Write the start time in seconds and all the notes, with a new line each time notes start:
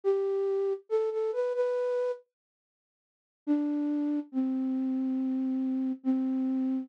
0.04 G4
0.89 A4
1.11 A4
1.33 B4
1.54 B4
3.47 D4
4.32 C4
6.04 C4